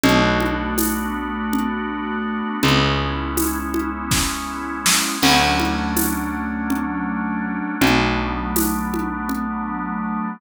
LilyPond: <<
  \new Staff \with { instrumentName = "Drawbar Organ" } { \time 7/8 \key b \dorian \tempo 4 = 81 <a b d' fis'>2.~ <a b d' fis'>8 | <gis b cis' e'>2.~ <gis b cis' e'>8 | <fis a cis' d'>2.~ <fis a cis' d'>8 | <fis a b d'>2.~ <fis a b d'>8 | }
  \new Staff \with { instrumentName = "Electric Bass (finger)" } { \clef bass \time 7/8 \key b \dorian b,,2.~ b,,8 | cis,2.~ cis,8 | d,2.~ d,8 | b,,2.~ b,,8 | }
  \new DrumStaff \with { instrumentName = "Drums" } \drummode { \time 7/8 cgl8 cgho8 <cgho tamb>4 cgl4. | cgl4 <cgho tamb>8 cgho8 <bd sn>4 sn8 | <cgl cymc>8 cgho8 <cgho tamb>4 cgl4. | cgl4 <cgho tamb>8 cgho8 cgl4. | }
>>